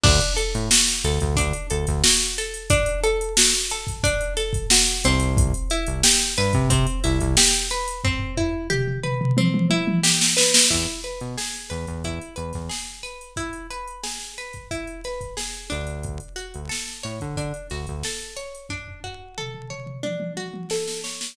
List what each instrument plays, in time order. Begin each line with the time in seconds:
0.03 synth bass 1 D2, pizzicato strings D4, kick, crash
0.20 closed hi-hat
0.36 pizzicato strings A4, closed hi-hat
0.54 synth bass 1 A2, closed hi-hat
0.71 pizzicato strings F#4, snare
0.87 snare, closed hi-hat
1.04 synth bass 1 D2, pizzicato strings A4, closed hi-hat
1.20 synth bass 1 D2, kick, closed hi-hat
1.36 synth bass 1 D2, pizzicato strings D4, kick, closed hi-hat
1.53 closed hi-hat
1.70 synth bass 1 D2, pizzicato strings A4, closed hi-hat
1.87 synth bass 1 D2, kick, snare, closed hi-hat
2.04 pizzicato strings F#4, snare
2.20 closed hi-hat
2.38 pizzicato strings A4, closed hi-hat
2.54 closed hi-hat
2.70 pizzicato strings D4, kick, closed hi-hat
2.86 closed hi-hat
3.03 pizzicato strings A4, closed hi-hat
3.21 closed hi-hat
3.37 pizzicato strings F#4, snare
3.53 snare, closed hi-hat
3.70 pizzicato strings A4, closed hi-hat
3.87 kick, closed hi-hat
4.03 pizzicato strings D4, kick, closed hi-hat
4.21 closed hi-hat
4.37 pizzicato strings A4, snare, closed hi-hat
4.53 kick, closed hi-hat
4.70 pizzicato strings F#4, snare
4.87 closed hi-hat
5.04 synth bass 1 C2, pizzicato strings C4, closed hi-hat
5.20 closed hi-hat
5.37 kick, closed hi-hat
5.54 closed hi-hat
5.70 pizzicato strings E4, closed hi-hat
5.87 synth bass 1 C2, closed hi-hat
6.03 pizzicato strings G4, snare
6.20 snare, closed hi-hat
6.37 synth bass 1 G2, pizzicato strings B4, closed hi-hat
6.53 synth bass 1 C3, kick, closed hi-hat
6.70 synth bass 1 C3, pizzicato strings C4, kick, closed hi-hat
6.87 closed hi-hat
7.04 synth bass 1 C2, pizzicato strings E4, snare, closed hi-hat
7.20 synth bass 1 C2, kick, closed hi-hat
7.37 pizzicato strings G4, snare
7.53 closed hi-hat
7.70 pizzicato strings B4, closed hi-hat
7.88 closed hi-hat
8.04 pizzicato strings C4, kick, floor tom
8.19 floor tom
8.37 pizzicato strings E4, floor tom
8.70 pizzicato strings G4, mid tom
8.87 mid tom
9.03 pizzicato strings B4, mid tom
9.21 mid tom
9.37 pizzicato strings C4, high tom
9.54 high tom
9.70 pizzicato strings E4, high tom
9.87 high tom
10.03 pizzicato strings G4, snare
10.21 snare
10.37 pizzicato strings B4, snare
10.54 snare
10.70 synth bass 1 E2, pizzicato strings E4, kick, crash
10.88 closed hi-hat
11.04 pizzicato strings B4, closed hi-hat
11.20 synth bass 1 B2, closed hi-hat
11.37 pizzicato strings G#4, snare
11.53 snare, closed hi-hat
11.70 synth bass 1 E2, pizzicato strings B4, closed hi-hat
11.87 synth bass 1 E2, kick, closed hi-hat
12.04 synth bass 1 E2, pizzicato strings E4, kick, closed hi-hat
12.21 closed hi-hat
12.36 synth bass 1 E2, pizzicato strings B4, closed hi-hat
12.53 synth bass 1 E2, kick, snare, closed hi-hat
12.69 pizzicato strings G#4, snare
12.87 closed hi-hat
13.03 pizzicato strings B4, closed hi-hat
13.21 closed hi-hat
13.36 pizzicato strings E4, kick, closed hi-hat
13.53 closed hi-hat
13.70 pizzicato strings B4, closed hi-hat
13.88 closed hi-hat
14.03 pizzicato strings G#4, snare
14.19 snare, closed hi-hat
14.38 pizzicato strings B4, closed hi-hat
14.53 kick, closed hi-hat
14.71 pizzicato strings E4, kick, closed hi-hat
14.87 closed hi-hat
15.04 pizzicato strings B4, snare, closed hi-hat
15.21 kick, closed hi-hat
15.37 pizzicato strings G#4, snare
15.54 closed hi-hat
15.70 synth bass 1 D2, pizzicato strings D4, closed hi-hat
15.87 closed hi-hat
16.03 kick, closed hi-hat
16.20 closed hi-hat
16.36 pizzicato strings F#4, closed hi-hat
16.54 synth bass 1 D2, closed hi-hat
16.69 pizzicato strings A4, snare
16.88 snare, closed hi-hat
17.03 synth bass 1 A2, pizzicato strings C#5, closed hi-hat
17.20 synth bass 1 D3, kick, closed hi-hat
17.36 synth bass 1 D3, pizzicato strings D4, kick, closed hi-hat
17.54 closed hi-hat
17.70 synth bass 1 D2, pizzicato strings F#4, snare, closed hi-hat
17.87 synth bass 1 D2, kick, closed hi-hat
18.03 pizzicato strings A4, snare
18.20 closed hi-hat
18.37 pizzicato strings C#5, closed hi-hat
18.55 closed hi-hat
18.69 pizzicato strings D4, kick, floor tom
18.88 floor tom
19.04 pizzicato strings F#4, floor tom
19.38 pizzicato strings A4, mid tom
19.54 mid tom
19.70 pizzicato strings C#5, mid tom
19.86 mid tom
20.03 pizzicato strings D4, high tom
20.20 high tom
20.37 pizzicato strings F#4, high tom
20.54 high tom
20.70 pizzicato strings A4, snare
20.87 snare
21.04 pizzicato strings C#5, snare
21.21 snare